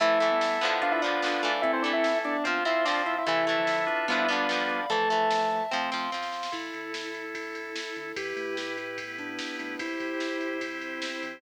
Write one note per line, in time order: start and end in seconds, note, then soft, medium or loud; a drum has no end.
0.00 0.17 A1 medium
0.00 0.19 E3 loud
0.00 0.30 F3 medium
0.00 0.19 A3 loud
0.00 0.30 A3 medium
0.00 0.74 E4 medium
0.00 0.80 E4 loud
0.00 0.74 A4 medium
0.00 0.81 E5 medium
0.00 0.80 E5 loud
0.00 0.81 A5 medium
0.00 kick loud
0.00 closed hi-hat loud
0.20 0.38 A1 medium
0.20 0.59 E3 medium
0.20 0.59 A3 medium
0.20 closed hi-hat medium
0.31 0.58 G3 medium
0.31 0.58 B3 medium
0.40 0.58 A1 medium
0.40 snare loud
0.61 0.79 A1 medium
0.61 1.01 D3 loud
0.61 1.01 F3 loud
0.61 1.01 B3 loud
0.61 closed hi-hat medium
0.81 0.99 B1 medium
0.81 1.55 D4 loud
0.81 1.47 D4 medium
0.81 1.55 F4 medium
0.81 1.47 F4 medium
0.81 0.92 F4 medium
0.81 1.55 B4 medium
0.81 1.62 D5 medium
0.81 1.62 F5 medium
0.81 0.92 F5 medium
0.81 1.62 B5 medium
0.81 kick medium
0.81 closed hi-hat loud
0.92 1.01 E4 medium
0.92 1.01 E5 loud
1.02 1.19 B1 medium
1.02 1.21 F3 medium
1.02 1.21 B3 medium
1.02 1.61 D4 medium
1.02 1.61 D5 medium
1.02 closed hi-hat medium
1.06 1.21 D3 medium
1.22 1.40 B1 medium
1.22 1.42 D3 medium
1.22 1.42 F3 medium
1.22 1.42 B3 medium
1.22 snare loud
1.43 1.60 B1 medium
1.43 1.82 E3 loud
1.43 1.82 A3 loud
1.43 closed hi-hat medium
1.62 1.80 A1 medium
1.62 2.12 C4 loud
1.62 1.72 E4 medium
1.62 2.36 E4 medium
1.62 2.12 E4 loud
1.62 2.36 A4 medium
1.62 1.72 E5 loud
1.62 2.44 E5 medium
1.62 2.44 A5 medium
1.62 kick loud
1.62 closed hi-hat loud
1.73 1.83 C4 medium
1.73 1.83 C5 loud
1.82 2.01 A1 medium
1.82 2.40 E3 medium
1.82 2.40 A3 medium
1.82 1.92 D4 medium
1.82 1.92 D5 loud
1.82 closed hi-hat medium
1.93 2.19 E4 medium
1.93 2.19 E5 medium
2.04 2.22 A1 medium
2.04 snare loud
2.24 2.42 A1 medium
2.24 2.59 B3 medium
2.24 2.45 D4 medium
2.24 2.59 D4 medium
2.24 2.45 D5 loud
2.24 closed hi-hat medium
2.44 2.62 F2 medium
2.44 2.64 F3 loud
2.44 2.64 C4 medium
2.44 3.17 F4 loud
2.44 2.64 F4 medium
2.44 3.17 C5 medium
2.44 3.26 F5 medium
2.44 2.64 F5 medium
2.44 3.26 C6 medium
2.44 kick loud
2.44 closed hi-hat loud
2.65 2.83 F2 medium
2.65 2.84 F3 medium
2.65 2.84 C4 medium
2.65 2.85 E4 medium
2.65 2.85 E5 medium
2.65 closed hi-hat medium
2.85 3.03 F2 medium
2.85 3.23 F3 medium
2.85 3.23 C4 medium
2.85 3.03 D4 medium
2.85 3.03 D5 medium
2.85 snare loud
3.06 3.23 F2 medium
3.06 3.16 E4 medium
3.06 3.16 E5 medium
3.06 closed hi-hat medium
3.18 3.27 E4 medium
3.18 3.27 E5 medium
3.26 3.44 A1 medium
3.26 3.57 C3 loud
3.26 3.57 E3 loud
3.26 3.45 E3 loud
3.26 3.45 A3 medium
3.26 3.85 E4 loud
3.26 4.06 E4 loud
3.26 3.85 A4 loud
3.26 4.08 E5 medium
3.26 4.06 E5 loud
3.26 4.08 A5 medium
3.26 kick loud
3.26 closed hi-hat loud
3.47 3.64 A1 medium
3.47 4.03 E3 medium
3.47 4.03 A3 medium
3.47 closed hi-hat medium
3.57 3.86 D3 medium
3.57 3.86 F3 loud
3.67 3.85 A1 medium
3.67 snare loud
3.87 4.05 A1 medium
3.87 4.80 D4 loud
3.87 4.80 F4 loud
3.87 4.80 B4 loud
3.87 closed hi-hat medium
4.08 4.25 B1 medium
4.08 4.27 F3 loud
4.08 4.80 G3 medium
4.08 4.80 B3 medium
4.08 4.27 B3 loud
4.08 4.19 E4 medium
4.08 4.88 D5 medium
4.08 4.19 E5 medium
4.08 4.88 F5 medium
4.08 4.88 B5 medium
4.08 kick loud
4.08 closed hi-hat loud
4.12 4.27 D3 medium
4.19 4.29 E4 medium
4.19 4.29 E5 medium
4.28 4.46 B1 medium
4.28 4.47 D3 medium
4.28 4.47 F3 medium
4.28 4.47 B3 loud
4.28 4.85 D4 medium
4.28 4.85 D5 loud
4.28 closed hi-hat medium
4.49 4.66 B1 medium
4.49 4.86 D3 medium
4.49 4.86 F3 medium
4.49 4.86 B3 medium
4.49 snare loud
4.69 4.86 B1 medium
4.69 closed hi-hat medium
4.90 5.07 A1 medium
4.90 5.09 E3 medium
4.90 5.61 F3 medium
4.90 5.61 A3 loud
4.90 5.09 A3 loud
4.90 5.63 A4 medium
4.90 5.71 E5 medium
4.90 5.63 A5 loud
4.90 5.71 A5 medium
4.90 kick loud
4.90 closed hi-hat loud
5.10 5.28 A1 medium
5.10 5.67 E3 medium
5.10 5.67 A3 medium
5.10 closed hi-hat medium
5.31 5.48 A1 medium
5.31 snare loud
5.51 5.69 A1 medium
5.51 closed hi-hat medium
5.71 5.89 F2 medium
5.71 5.90 F3 loud
5.71 6.07 A3 medium
5.71 5.90 C4 medium
5.71 6.07 C4 medium
5.71 6.52 F5 medium
5.71 6.52 C6 medium
5.71 kick medium
5.71 snare medium
5.92 6.09 F2 medium
5.92 6.11 F3 medium
5.92 6.11 C4 medium
5.92 snare medium
6.12 6.30 F2 medium
6.12 6.50 F3 medium
6.12 6.50 C4 medium
6.12 snare medium
6.22 snare medium
6.32 6.50 F2 medium
6.32 snare medium
6.43 snare loud
6.52 6.70 A1 loud
6.52 8.12 E4 medium
6.52 7.25 E4 medium
6.52 8.15 E4 medium
6.52 8.12 A4 medium
6.52 8.15 A4 medium
6.52 kick loud
6.52 crash loud
6.73 7.78 D2 medium
6.73 ride medium
6.94 snare loud
7.14 ride medium
7.35 8.03 E4 medium
7.35 kick medium
7.35 ride loud
7.55 ride medium
7.76 snare loud
7.96 8.13 D2 medium
7.96 ride medium
8.16 8.34 E2 loud
8.16 8.97 E4 medium
8.16 9.76 E4 medium
8.16 8.97 G4 medium
8.16 9.76 G4 medium
8.16 8.55 G4 medium
8.16 8.97 B4 medium
8.16 9.76 B4 medium
8.16 kick loud
8.16 ride loud
8.36 9.40 A2 medium
8.36 ride medium
8.57 8.76 G4 medium
8.57 snare loud
8.77 8.97 E4 medium
8.77 ride medium
8.98 9.79 B3 medium
8.98 9.79 E4 medium
8.98 9.79 B4 medium
8.98 kick loud
8.98 ride loud
9.18 9.56 D4 medium
9.18 kick medium
9.18 ride medium
9.39 snare loud
9.59 9.77 A2 medium
9.59 9.79 D4 medium
9.59 ride medium
9.79 9.97 C2 loud
9.79 11.39 E4 medium
9.79 10.61 E4 medium
9.79 10.57 E4 medium
9.79 11.39 G4 medium
9.79 10.61 G4 medium
9.79 11.39 C5 medium
9.79 10.61 C5 medium
9.79 kick loud
9.79 ride loud
10.00 11.04 F2 medium
10.00 kick medium
10.00 ride medium
10.20 snare loud
10.41 ride medium
10.61 11.41 C4 medium
10.61 11.33 E4 medium
10.61 11.41 E4 medium
10.61 11.41 C5 medium
10.61 kick loud
10.61 ride loud
10.81 ride medium
11.02 snare loud
11.23 11.40 F2 medium
11.23 ride medium